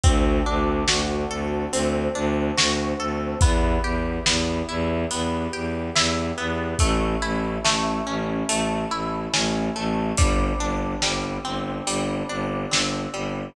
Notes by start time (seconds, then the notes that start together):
0.04 D2 C4 D4 F#4 A4, kick, closed hi-hat
0.46 D2 D4
0.88 D2 F#4, snare
1.30 D2 A4
1.72 D2 C4 D4 A4 C5, closed hi-hat
2.15 D2 D4
2.57 D2 F#4, snare
2.99 D2 A4
3.41 E2 B3 E4 G4, kick, closed hi-hat
3.83 E2 G4
4.26 E2 B3, snare
4.69 E2 E4
5.11 E2 B3 G4 B4, closed hi-hat
5.53 E2 G4
5.95 E2 E4, snare
6.38 E2 B3
6.79 A1 A3 C#4 E4, kick, closed hi-hat
7.22 A1 E4
7.64 A1 A3, snare
8.07 A1 C#4
8.48 A1 A3 E4 A4, closed hi-hat
8.91 A1 E4
9.33 A1 C#4, snare
9.76 A1 A3
10.17 G1 G3 C4 D4, kick, closed hi-hat
10.59 G1 D4
11.02 G1 G3, snare
11.45 G1 C4
11.87 G1 G3, closed hi-hat
12.29 G1 D4
12.71 G1 C4, snare
13.13 G1 G3